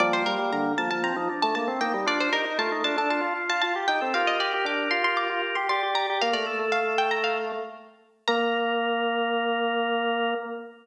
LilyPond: <<
  \new Staff \with { instrumentName = "Pizzicato Strings" } { \time 4/4 \key bes \major \tempo 4 = 116 d''16 c''16 bes'8 bes''8 a''16 a''16 bes''8. a''16 a''16 r16 g''8 | d''16 c''16 bes'8 a''8 a''16 a''16 a''8. a''16 a''16 r16 g''8 | f''16 ees''16 d''8 d'''8 c'''16 c'''16 d'''8. c'''16 c'''16 r16 bes''8 | f''16 d''16 r8 f''8 g''16 bes''16 f''4 r4 |
bes''1 | }
  \new Staff \with { instrumentName = "Drawbar Organ" } { \time 4/4 \key bes \major <g bes>4. bes16 bes16 c'16 ees'16 d'8. r16 ees'16 ees'16 | f'16 f'16 g'16 r16 f'16 ees'16 f'16 a'16 f'4. g'16 a'16 | <g' bes'>2. d''4 | bes'8 a'16 a'4.~ a'16 r4. |
bes'1 | }
  \new Staff \with { instrumentName = "Drawbar Organ" } { \time 4/4 \key bes \major f8 g16 g16 d8 f16 f8 f16 r16 a16 bes16 c'16 bes16 g16 | d'8 ees'16 ees'16 a8 d'16 d'8 f'16 r16 f'16 f'16 g'16 ees'16 c'16 | f'8 g'16 g'16 d'8 f'16 f'8 f'16 r16 g'16 g'16 g'16 g'16 g'16 | bes16 a2~ a8. r4 |
bes1 | }
>>